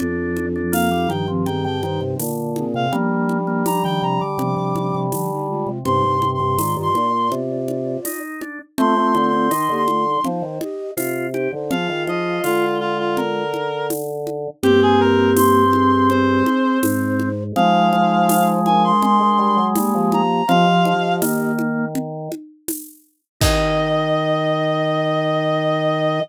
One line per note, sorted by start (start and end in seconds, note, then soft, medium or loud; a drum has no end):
0.00 1.08 F2 medium
0.00 0.62 F3 medium
0.00 0.46 D4 loud
0.00 0.62 D4 loud
0.00 low conga medium
0.37 high conga medium
0.56 0.73 D4 medium
0.72 0.90 A#3 medium
0.72 1.09 F5 medium
0.72 tambourine medium
0.72 high conga medium
0.91 1.09 G3 medium
0.91 1.09 D#4 medium
1.09 2.15 G2 medium
1.09 1.26 D#3 medium
1.09 1.27 F3 medium
1.09 1.27 D4 medium
1.09 1.27 G5 medium
1.09 high conga medium
1.28 1.46 D#3 medium
1.28 1.45 F3 medium
1.28 1.46 C4 medium
1.46 1.65 D#3 medium
1.46 1.81 C4 medium
1.46 1.81 G#4 medium
1.46 1.63 G5 medium
1.46 low conga medium
1.64 1.82 D3 medium
1.64 1.82 G5 medium
1.83 2.01 D#3 medium
1.83 2.18 D#4 medium
1.83 2.18 C5 medium
1.83 2.00 G5 medium
1.83 high conga medium
2.01 2.18 C3 medium
2.19 2.86 A#2 medium
2.19 2.65 D3 medium
2.19 tambourine medium
2.19 high conga medium
2.56 2.74 C4 medium
2.56 2.74 G#4 medium
2.56 high conga medium
2.74 2.91 C3 loud
2.74 2.92 C4 medium
2.74 2.92 G#4 medium
2.74 2.93 F5 medium
2.92 4.21 F3 medium
2.92 5.69 G3 medium
2.92 3.38 A#3 loud
2.92 4.21 D4 loud
2.92 low conga medium
3.29 high conga medium
3.47 3.64 A#3 medium
3.66 3.83 G3 medium
3.66 3.83 A#5 medium
3.66 tambourine medium
3.66 high conga medium
3.84 4.01 D#3 medium
3.84 4.02 G5 loud
4.02 4.20 C3 medium
4.02 4.20 A#5 medium
4.21 4.38 D3 medium
4.21 4.99 D6 medium
4.38 4.55 C3 loud
4.38 5.07 F3 medium
4.38 5.07 D4 medium
4.38 low conga medium
4.57 4.74 C3 medium
4.75 4.93 C3 medium
4.75 high conga medium
4.95 5.12 C3 loud
5.12 5.65 D3 medium
5.12 5.30 F3 medium
5.12 5.30 D4 medium
5.12 tambourine medium
5.12 high conga medium
5.31 5.48 G3 medium
5.31 5.48 D#4 medium
5.48 5.79 G#3 medium
5.48 5.79 F4 medium
5.67 5.84 C3 medium
5.85 6.03 G2 medium
5.85 6.03 C3 loud
5.85 6.17 D#4 medium
5.85 6.17 C5 loud
5.85 6.28 C6 medium
5.85 low conga medium
6.04 6.21 G2 medium
6.04 6.21 C3 medium
6.22 6.40 G2 medium
6.22 6.39 C3 loud
6.22 high conga medium
6.34 6.74 C6 medium
6.40 6.58 G2 medium
6.40 6.57 C3 loud
6.58 6.76 G#2 medium
6.58 6.89 D#3 medium
6.58 6.76 F4 medium
6.58 6.76 D5 medium
6.58 tambourine medium
6.58 high conga medium
6.76 6.94 G2 medium
6.76 7.10 F4 medium
6.76 7.10 D5 medium
6.83 7.30 C6 medium
6.94 7.29 A#2 medium
6.94 high conga medium
7.13 8.20 F4 medium
7.13 8.20 D5 medium
7.31 7.97 C3 medium
7.31 low conga medium
7.68 high conga medium
8.05 8.41 D#4 medium
8.05 tambourine medium
8.05 high conga medium
8.41 8.59 D4 medium
8.41 high conga medium
8.78 8.95 A3 medium
8.78 9.48 A3 loud
8.78 8.96 C4 loud
8.78 9.48 F4 loud
8.78 9.26 C6 medium
8.78 low conga loud
8.96 9.14 A3 medium
8.96 9.14 C4 medium
9.15 9.50 D3 medium
9.15 9.32 C4 medium
9.15 high conga medium
9.27 9.74 C6 medium
9.33 9.50 C4 medium
9.51 9.69 D#3 medium
9.51 9.83 D#4 medium
9.51 tambourine medium
9.51 high conga medium
9.69 10.18 D3 medium
9.69 9.87 A#3 medium
9.69 9.87 G4 medium
9.76 10.23 C6 medium
9.88 10.05 A3 medium
9.88 10.05 F4 medium
9.88 high conga medium
10.05 10.23 G3 medium
10.05 10.23 D#4 medium
10.24 10.42 F3 medium
10.24 10.59 D#4 medium
10.24 10.59 C5 medium
10.24 low conga medium
10.42 10.59 D#3 medium
10.61 10.91 G4 medium
10.61 10.91 D#5 loud
10.61 high conga medium
10.97 11.48 C3 medium
10.97 11.27 F4 loud
10.97 tambourine medium
10.97 high conga medium
11.34 11.52 D#4 medium
11.34 11.52 G4 medium
11.34 11.52 C5 medium
11.34 high conga medium
11.53 11.70 D3 medium
11.53 11.70 D#4 medium
11.53 11.70 C5 medium
11.70 11.88 F3 medium
11.70 12.66 F4 loud
11.70 12.05 G#4 medium
11.70 12.04 F5 medium
11.70 12.05 F5 loud
11.70 low conga medium
11.89 12.07 D#3 medium
12.07 12.39 F3 medium
12.07 12.40 G#4 medium
12.07 12.40 D#5 medium
12.07 12.40 F5 medium
12.07 high conga medium
12.43 14.48 D3 medium
12.43 13.43 G#3 medium
12.43 12.78 F4 medium
12.43 13.43 F4 medium
12.43 tambourine medium
12.43 high conga medium
12.80 12.97 F4 medium
12.99 13.16 F4 medium
13.17 13.87 A#4 medium
13.17 low conga medium
13.54 high conga medium
13.90 tambourine medium
13.90 high conga medium
14.27 high conga medium
14.63 16.43 G2 medium
14.63 15.64 A#3 loud
14.63 17.29 C4 loud
14.63 14.80 G4 loud
14.63 15.64 G4 loud
14.63 low conga loud
14.82 15.00 G#4 medium
15.00 15.31 A#4 loud
15.37 16.08 C6 medium
15.37 tambourine medium
15.37 high conga medium
15.73 16.79 C4 medium
15.73 16.79 G#4 loud
15.73 high conga medium
16.10 16.80 C5 medium
16.10 low conga medium
16.46 high conga medium
16.83 17.52 G#2 medium
16.83 17.44 D#4 medium
16.83 17.44 C5 loud
16.83 tambourine medium
16.83 high conga loud
17.20 high conga medium
17.56 17.91 F3 medium
17.56 20.21 G#3 loud
17.56 18.60 D#4 loud
17.56 18.60 C5 loud
17.56 18.48 F5 loud
17.56 low conga medium
17.92 18.92 F3 medium
17.92 high conga medium
18.29 tambourine medium
18.29 high conga medium
18.65 19.59 D4 medium
18.65 19.59 A#4 medium
18.65 18.83 G#5 medium
18.65 high conga medium
18.84 19.02 C6 loud
19.02 19.19 G#3 medium
19.02 19.65 C6 loud
19.02 low conga medium
19.20 19.38 G#3 medium
19.38 19.56 G3 medium
19.57 19.74 F#3 medium
19.75 19.94 G3 medium
19.75 20.43 A#3 loud
19.75 20.43 G4 loud
19.75 tambourine medium
19.75 high conga loud
19.95 20.11 F3 medium
20.12 20.42 F3 medium
20.12 20.48 A#5 medium
20.12 high conga medium
20.48 20.66 F3 medium
20.48 20.94 F3 loud
20.48 21.52 G4 medium
20.48 21.52 D#5 loud
20.48 21.14 F5 loud
20.48 low conga medium
20.85 21.21 F3 medium
20.85 high conga medium
21.22 22.29 D#3 medium
21.22 21.86 A#3 loud
21.22 tambourine medium
21.22 high conga medium
21.59 high conga medium
21.95 low conga medium
22.32 high conga medium
22.68 tambourine medium
22.68 high conga medium
23.41 26.20 D#3 loud
23.41 26.19 D#4 loud
23.41 26.20 D#5 loud
23.41 26.21 D#5 loud
23.41 kick loud
23.41 crash loud